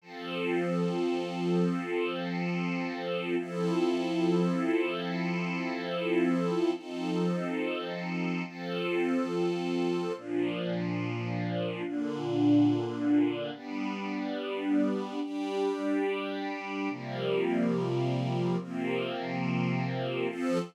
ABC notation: X:1
M:12/8
L:1/8
Q:3/8=71
K:Flyd
V:1 name="String Ensemble 1"
[F,CA]12 | [F,CEA]12 | [F,C_EA]6 [F,CFA]6 | [_B,,F,D]6 [B,,D,D]6 |
[G,B,D]6 [G,DG]6 | [C,F,G,_B,]6 [C,F,B,C]6 | [F,CA]3 z9 |]